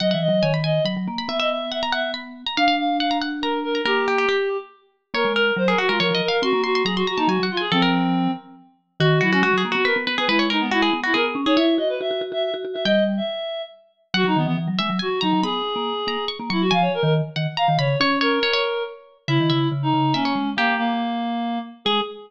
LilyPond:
<<
  \new Staff \with { instrumentName = "Pizzicato Strings" } { \time 3/4 \key gis \minor \tempo 4 = 140 fis''16 fis''8. gis''16 b''16 gis''8 b''8. b''16 | e''16 e''8. fis''16 ais''16 fis''8 b''8. ais''16 | eis''16 eis''8. fis''16 ais''16 fis''8 ais''8. ais''16 | ais'8 g'16 g'16 g'8 r4. |
\key bes \minor des''8 bes'8. aes'16 ges'16 bes'16 \tuplet 3/2 { des''8 ees''8 f''8 } | c'''8 c'''16 c'''16 bes''16 c'''16 bes''16 a''16 \tuplet 3/2 { aes''8 ges''8 aes''8 } | a'16 bes'4.~ bes'16 r4 | \key gis \minor fis'8 fis'16 fis'16 \tuplet 3/2 { fis'8 gis'8 fis'8 } b'8 b'16 gis'16 |
b'16 cis''16 ais'8 fis'16 gis'8 fis'16 gis'8. gis'16 | cis''2. | g''2 r4 | \key b \major fis''4. e''8 gis''16 r16 ais''8 |
b''4. ais''8 cis'''16 r16 cis'''8 | gis''4. fis''8 ais''16 r16 b''8 | cis''8 cis''8 cis''16 cis''4.~ cis''16 | \key gis \minor e''8 e''4. e''16 cis''8. |
g'2~ g'8 r8 | gis'4 r2 | }
  \new Staff \with { instrumentName = "Clarinet" } { \time 3/4 \key gis \minor dis''16 e''16 dis''8 cis''16 r16 dis''8 r4 | e''16 dis''16 e''8 e''16 r16 e''8 r4 | eis''8 eis''8 eis''8 r8 ais'8 ais'8 | g'2 r4 |
\key bes \minor bes'8 bes'8 c''16 bes'16 ges'16 f'16 bes'8 bes'16 bes'16 | ges'8 ges'8 aes'16 ges'16 ges'16 ees'16 ges'8 f'16 aes'16 | c'4. r4. | \key gis \minor fis'8 e'16 cis'16 fis'8 r16 fis'16 ais'16 r8 b'16 |
e'8 dis'16 b16 e'8 r16 e'16 ais'16 r8 cis''16 | e''8 dis''16 b'16 e''8 r16 e''16 e''16 r8 e''16 | dis''8 r16 e''4~ e''16 r4 | \key b \major fis'16 dis'16 b16 b16 r4 fis'8 dis'8 |
gis'2 r8 e'16 fis'16 | eis''16 cis''16 ais'16 ais'16 r4 eis''8 cis''8 | cis''8 ais'4. r4 | \key gis \minor e'4 r16 dis'8. cis'4 |
ais8 ais2 r8 | gis'4 r2 | }
  \new Staff \with { instrumentName = "Vibraphone" } { \time 3/4 \key gis \minor \tuplet 3/2 { fis8 e8 fis8 } dis4 fis16 fis16 ais8 | b2. | d'2. | ais4 r2 |
\key bes \minor bes16 aes8. ges8 r16 aes16 f16 f16 r8 | c'16 bes8. ges8 r16 bes16 ges16 ges16 r8 | f4. r4. | \key gis \minor dis8 fis8 gis16 fis16 ais16 b8 b16 b16 b16 |
gis4. b8 b8 cis'16 dis'16 | e'8 fis'8 fis'16 fis'16 fis'16 fis'8 fis'16 fis'16 fis'16 | g4 r2 | \key b \major fis16 fis16 dis16 e16 e16 fis16 gis16 fis16 r8 fis16 fis16 |
b8 r16 ais8 r16 ais16 r8 ais16 fis8 | eis8 r16 dis8 r16 dis16 r8 dis16 cis8 | cis'4 r2 | \key gis \minor cis16 dis16 cis8 cis8 cis8 ais8 gis8 |
ais4 r2 | gis4 r2 | }
>>